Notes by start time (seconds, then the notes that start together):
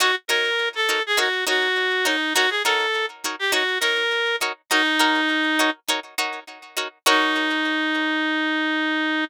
0.00 D#4 F#4 A#4 C#5
0.28 D#4 F#4 A#4 C#5
0.75 A4
0.89 D#4 F#4 A#4 C#5
1.06 G#4
1.17 D#4 F#4 A#4 C#5
1.47 D#4 F#4 A#4 C#5
2.05 D#4 F#4 A#4 C#5
2.34 D#4 F#4 A#4 C#5
2.50 G#4
2.65 D#4 F#4 A4 A#4 C#5
3.24 D#4 F#4 A#4 C#5
3.39 G4
3.52 D#4 F#4 A#4 C#5
3.80 D#4 F#4 A#4 C#5
4.41 D#4 F#4 A#4 C#5
4.70 D#4 F#4 A#4 C#5
4.99 D#4 F#4 A#4 C#5
5.59 D#4 F#4 A#4 C#5
5.88 D#4 F#4 A#4 C#5
6.18 D#4 F#4 A#4 C#5
6.77 D#4 F#4 A#4 C#5
7.06 D#4 F#4 A#4 C#5